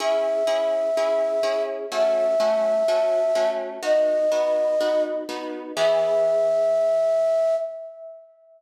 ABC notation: X:1
M:4/4
L:1/8
Q:1/4=125
K:E
V:1 name="Flute"
e8 | e8 | d6 z2 | e8 |]
V:2 name="Orchestral Harp"
[CEG]2 [CEG]2 [CEG]2 [CEG]2 | [A,CF]2 [A,CF]2 [A,CF]2 [A,CF]2 | [B,DF]2 [B,DF]2 [B,DF]2 [B,DF]2 | [E,B,G]8 |]